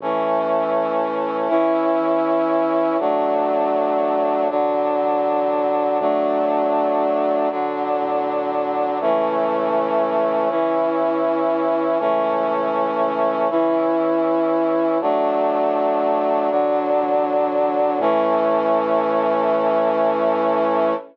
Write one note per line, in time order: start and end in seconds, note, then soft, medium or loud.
0.00 0.90 A1 loud
0.00 1.48 E3 medium
0.00 1.50 A3 medium
0.00 1.48 C#4 medium
1.01 1.91 A1 medium
1.49 2.97 E3 medium
1.49 2.97 C#4 medium
1.49 2.97 E4 medium
2.00 2.90 E2 medium
2.99 3.91 A1 medium
2.99 4.48 F#3 medium
2.99 4.48 A3 medium
2.99 4.48 D4 medium
3.99 4.89 A1 medium
4.50 5.98 D3 medium
4.50 5.98 F#3 medium
4.50 5.98 D4 medium
5.00 5.90 A1 medium
6.00 6.90 D2 loud
6.00 7.48 F#3 medium
6.00 7.48 A3 medium
6.00 7.48 D4 medium
7.00 7.90 D2 medium
7.50 8.99 D3 medium
7.50 8.99 F#3 medium
7.50 8.99 D4 medium
8.01 8.91 A2 medium
9.01 9.91 C#2 loud
9.01 10.49 E3 medium
9.01 10.49 A3 medium
9.01 10.49 C#4 medium
9.99 10.89 C#2 medium
10.49 11.98 E3 medium
10.49 11.98 C#4 medium
10.49 11.98 E4 medium
11.00 11.90 E2 medium
11.99 12.90 C#2 loud
11.99 13.48 E3 medium
11.99 13.48 A3 medium
11.99 13.48 C#4 medium
13.00 13.90 C#2 medium
13.50 14.98 E3 medium
13.50 14.98 C#4 medium
13.50 14.98 E4 medium
14.00 14.90 E2 medium
15.00 15.90 A1 medium
15.00 16.49 F#3 medium
15.00 16.49 A3 medium
15.00 16.49 D4 medium
16.01 16.91 A1 medium
16.50 17.99 D3 medium
16.50 17.99 F#3 medium
16.50 17.99 D4 medium
17.00 17.90 A1 loud
17.99 20.92 A2 loud
17.99 20.94 E3 loud
17.99 20.94 A3 medium
17.99 20.94 C#4 loud